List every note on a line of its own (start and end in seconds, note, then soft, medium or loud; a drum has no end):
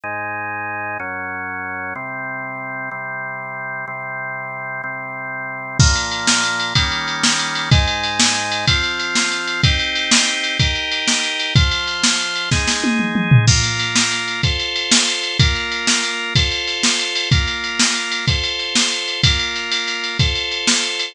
0.03 0.98 G#2 medium
0.03 0.98 G#3 medium
0.03 0.98 D#4 medium
1.00 1.94 F#2 medium
1.00 1.94 F#3 medium
1.00 1.94 C#4 medium
1.95 2.90 C3 medium
1.95 2.90 G3 medium
1.95 2.90 C4 medium
2.91 3.85 C3 medium
2.91 3.85 G3 medium
2.91 3.85 C4 medium
3.88 4.82 C3 medium
3.88 4.82 G3 medium
3.88 4.82 C4 medium
4.84 5.78 C3 medium
4.84 5.78 G3 medium
4.84 5.78 C4 medium
5.79 6.74 A#2 medium
5.79 6.74 F3 medium
5.79 6.74 A#3 medium
5.79 kick loud
5.79 crash medium
5.96 ride medium
6.11 ride medium
6.27 snare medium
6.44 ride medium
6.60 ride medium
6.75 7.70 D#3 medium
6.75 7.70 G3 medium
6.75 7.70 A#3 medium
6.75 7.70 C#4 medium
6.75 kick medium
6.75 ride loud
6.92 ride medium
7.08 ride medium
7.23 snare medium
7.39 ride medium
7.55 ride medium
7.71 8.66 G#2 medium
7.71 8.66 G#3 medium
7.71 8.66 D#4 medium
7.71 kick loud
7.71 ride medium
7.88 ride medium
8.03 ride medium
8.20 snare loud
8.35 ride medium
8.52 ride medium
8.67 9.62 F3 medium
8.67 9.62 C4 medium
8.67 9.62 F4 medium
8.67 kick medium
8.67 ride loud
8.83 ride medium
8.99 ride medium
9.15 snare medium
9.32 ride medium
9.47 ride medium
9.63 10.58 C4 medium
9.63 10.58 D#4 medium
9.63 10.58 G4 medium
9.63 kick medium
9.63 ride medium
9.79 ride medium
9.95 ride medium
10.11 snare loud
10.28 ride medium
10.43 ride medium
10.59 11.54 D#4 medium
10.59 11.54 G4 medium
10.59 11.54 A#4 medium
10.59 kick medium
10.59 ride medium
10.75 ride medium
10.91 ride medium
11.08 snare medium
11.23 ride medium
11.40 ride medium
11.55 12.50 F3 medium
11.55 12.50 F4 medium
11.55 12.50 C5 medium
11.55 kick loud
11.55 ride medium
11.71 ride medium
11.87 ride medium
12.03 snare medium
12.19 ride medium
12.36 ride medium
12.51 13.46 G#3 medium
12.51 13.46 D#4 medium
12.51 13.46 G#4 medium
12.51 kick medium
12.51 snare medium
12.67 snare medium
12.84 high tom medium
12.99 mid tom medium
13.15 mid tom medium
13.31 floor tom loud
13.47 14.42 A#3 medium
13.47 14.42 F4 medium
13.47 14.42 A#4 medium
13.47 kick medium
13.47 crash medium
13.63 ride medium
13.79 ride medium
13.95 snare medium
14.12 ride medium
14.28 ride medium
14.43 15.38 F4 medium
14.43 15.38 A4 medium
14.43 15.38 C5 medium
14.43 kick medium
14.43 ride medium
14.59 ride medium
14.76 ride medium
14.91 snare loud
15.08 ride medium
15.23 ride medium
15.39 16.34 A#3 medium
15.39 16.34 F4 medium
15.39 16.34 A#4 medium
15.39 kick medium
15.39 ride loud
15.55 ride medium
15.71 ride medium
15.87 snare medium
16.04 ride medium
16.35 17.30 F4 medium
16.35 17.30 A4 medium
16.35 17.30 C5 medium
16.35 kick medium
16.35 ride medium
16.51 ride medium
16.67 ride medium
16.83 snare medium
16.99 ride medium
17.15 ride medium
17.31 18.26 A#3 medium
17.31 18.26 F4 medium
17.31 18.26 A#4 medium
17.31 kick medium
17.31 ride medium
17.48 ride medium
17.64 ride medium
17.79 snare medium
17.95 ride medium
18.12 ride medium
18.27 19.22 F4 medium
18.27 19.22 A4 medium
18.27 19.22 C5 medium
18.27 kick medium
18.27 ride medium
18.43 ride medium
18.59 ride medium
18.75 snare medium
18.92 ride medium
19.08 ride medium
19.23 20.18 A#3 medium
19.23 20.18 F4 medium
19.23 20.18 A#4 medium
19.23 kick medium
19.23 ride loud
19.39 ride medium
19.56 ride medium
19.72 ride medium
19.88 ride medium
20.04 ride medium
20.19 21.13 F4 medium
20.19 21.13 A4 medium
20.19 21.13 C5 medium
20.19 kick medium
20.19 ride medium
20.35 ride medium
20.51 ride medium
20.67 snare medium
20.83 ride medium
20.99 ride medium